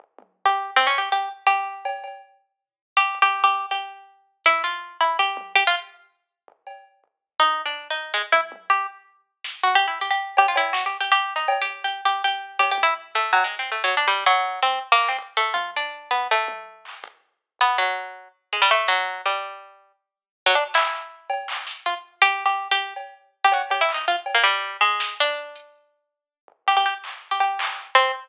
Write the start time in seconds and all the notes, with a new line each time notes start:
0.00 floor tom
0.19 high tom
0.45 G4
0.76 C4
0.87 C#4
0.98 G4
1.12 G4
1.47 G4
1.85 cowbell
2.04 cowbell
2.97 G4
3.15 kick
3.22 G4
3.44 G4
3.71 G4
4.44 E4, closed hi-hat
4.64 F4
5.01 E4
5.19 G4
5.37 high tom
5.55 G4
5.67 F4
6.48 floor tom
6.67 cowbell
7.04 floor tom
7.40 D#4
7.66 D4
7.90 D#4
8.14 G#3
8.32 E4, high tom
8.52 high tom
8.70 G4
9.44 snare
9.63 F#4
9.75 G4
9.88 E4
10.00 G4, kick
10.11 G4
10.37 G4, cowbell
10.48 F4
10.56 E4, cowbell
10.73 F#4, snare
10.86 G4
11.00 G4
11.12 G4
11.36 D#4
11.48 cowbell
11.61 G4
11.67 floor tom
11.84 G4
12.05 G4
12.24 G4
12.59 G4, cowbell
12.71 G4
12.78 high tom
12.83 E4
13.15 A3, kick
13.33 F#3, cowbell
13.44 G#3
13.59 C4
13.70 A3, floor tom
13.84 F#3
13.97 D4
14.08 G3
14.26 F#3
14.62 C4
14.81 floor tom
14.92 A#3
15.00 clap
15.08 C4
15.19 kick
15.37 A3
15.54 F4, high tom
15.76 D4
16.11 B3
16.31 A3
16.48 high tom
16.85 clap
17.04 kick
17.59 B3, floor tom
17.78 F#3
18.53 G#3
18.62 G3
18.71 A3
18.88 F#3
19.26 G3
20.46 F#3
20.55 D4
20.74 E4, clap
21.30 cowbell
21.48 clap
21.67 snare
21.86 F4
22.22 G4
22.41 floor tom
22.46 G4
22.71 G4
22.96 cowbell
23.44 G4
23.52 F#4, cowbell
23.70 G4, cowbell
23.81 E4
23.89 clap
23.94 D#4
24.08 F4
24.26 cowbell
24.35 A#3
24.44 G3, closed hi-hat
24.81 G#3, snare
25.00 snare
25.20 D4
25.56 closed hi-hat
26.48 floor tom
26.67 G4, floor tom
26.77 G4
26.86 G4
27.04 clap
27.31 G4
27.40 G4
27.59 clap
27.95 C4